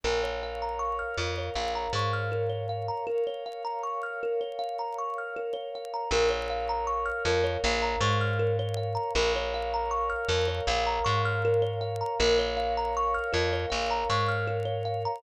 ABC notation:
X:1
M:4/4
L:1/16
Q:1/4=79
K:Bbm
V:1 name="Kalimba"
B d f b d' f' B d f b d' f' B d f b | B d f b d' f' B d f b d' f' B d f b | B d f b d' f' B d f b d' f' B d f b | B d f b d' f' B d f b d' f' B d f b |
B d f b d' f' B d f b d' f' B d f b |]
V:2 name="Electric Bass (finger)" clef=bass
B,,,6 F,,2 B,,,2 A,,6 | z16 | B,,,6 F,,2 B,,,2 A,,6 | B,,,6 F,,2 B,,,2 A,,6 |
B,,,6 F,,2 B,,,2 A,,6 |]
V:3 name="Pad 5 (bowed)"
[Bdf]16 | [Bdf]16 | [Bdf]16 | [Bdf]16 |
[Bdf]16 |]